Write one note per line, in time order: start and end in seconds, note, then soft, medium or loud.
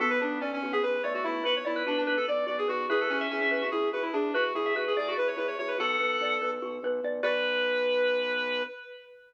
0.00 0.18 B1 medium
0.00 0.39 B3 loud
0.00 0.18 F#4 medium
0.00 0.10 A4 loud
0.10 0.20 B4 medium
0.20 0.38 B1 medium
0.20 0.38 D4 medium
0.20 0.39 B4 medium
0.41 0.59 B1 medium
0.41 0.51 C#4 medium
0.41 0.60 D5 medium
0.53 0.72 C#4 medium
0.62 0.80 B1 medium
0.62 0.82 F#4 medium
0.73 0.82 B3 medium
0.73 0.82 G#4 loud
0.83 1.00 B1 medium
0.83 1.02 B4 medium
1.03 1.21 B1 medium
1.03 1.23 A3 medium
1.03 1.13 C#5 medium
1.03 1.23 D5 medium
1.14 1.24 F#4 medium
1.24 1.42 B1 medium
1.24 1.42 A3 medium
1.24 1.44 E4 medium
1.24 1.43 F#4 medium
1.44 1.62 B1 medium
1.44 1.55 F#4 medium
1.44 1.62 B4 medium
1.44 1.55 B4 loud
1.56 1.66 C#5 medium
1.65 1.83 B1 medium
1.65 1.83 E4 medium
1.65 1.83 D5 medium
1.76 1.86 B4 medium
1.86 2.04 B1 medium
1.86 1.97 D4 medium
1.86 2.05 F#4 medium
1.86 2.03 B4 medium
1.98 2.16 D4 medium
2.07 2.24 B1 medium
2.07 2.26 B4 medium
2.17 2.27 A4 medium
2.28 2.45 B1 medium
2.28 2.45 D5 medium
2.28 2.48 D5 medium
2.46 2.66 B1 medium
2.46 2.65 F#4 medium
2.46 2.57 D5 medium
2.58 2.68 G#4 medium
2.68 2.87 B1 medium
2.68 2.86 F#4 loud
2.68 2.87 B4 medium
2.89 3.07 E2 medium
2.89 3.08 E4 medium
2.89 3.00 G#4 loud
2.89 3.18 B4 medium
3.00 3.10 A4 medium
3.10 3.28 E2 medium
3.10 3.27 C#4 loud
3.10 3.30 F#4 medium
3.21 3.67 E5 loud
3.30 3.49 E2 medium
3.30 3.40 C#4 medium
3.30 3.50 G#4 medium
3.41 3.61 C#4 medium
3.51 3.69 E2 medium
3.51 3.70 B4 medium
3.61 3.71 F#4 medium
3.71 3.90 E2 medium
3.71 3.91 E4 medium
3.71 3.89 G#4 medium
3.93 4.11 E2 medium
3.93 4.13 F#4 medium
3.93 4.03 B4 medium
4.02 4.12 E4 medium
4.13 4.31 E2 medium
4.13 4.33 D4 medium
4.13 4.32 G#4 medium
4.34 4.52 E2 medium
4.34 4.53 F#4 loud
4.34 4.53 B4 medium
4.34 4.44 B4 loud
4.55 4.73 E2 medium
4.55 4.74 E4 medium
4.55 4.73 G#4 medium
4.66 4.76 E5 medium
4.75 4.93 E2 medium
4.75 4.85 F#4 medium
4.75 4.94 F#4 medium
4.75 4.93 B4 medium
4.87 4.97 G#4 medium
4.95 5.14 E2 medium
4.95 5.14 G#4 medium
4.95 5.08 G#4 medium
4.95 5.15 D5 medium
5.08 5.17 F#4 medium
5.17 5.35 E2 medium
5.17 5.36 B4 medium
5.17 5.28 B4 medium
5.27 5.37 C#5 medium
5.37 5.56 E2 medium
5.37 5.55 E4 medium
5.37 5.47 B4 medium
5.48 5.57 C#5 medium
5.59 5.76 E2 medium
5.59 5.77 F#4 medium
5.59 5.69 C#5 medium
5.68 5.78 B4 medium
5.78 5.97 B1 medium
5.78 6.62 F#4 medium
5.78 6.51 A4 loud
5.78 6.34 F#5 loud
6.00 6.18 B1 medium
6.00 6.41 B4 medium
6.21 6.38 B1 medium
6.21 7.04 D5 medium
6.41 6.59 B1 medium
6.41 6.84 B4 medium
6.62 6.80 B1 medium
6.62 7.21 F#4 medium
6.83 7.00 B1 medium
6.83 7.23 B4 medium
7.04 7.21 B1 medium
7.04 7.23 D5 medium
7.23 8.63 B1 loud
7.23 8.62 F#4 medium
7.23 8.62 B4 loud
7.23 8.62 B4 medium
7.23 8.63 B4 loud
7.23 8.62 D5 loud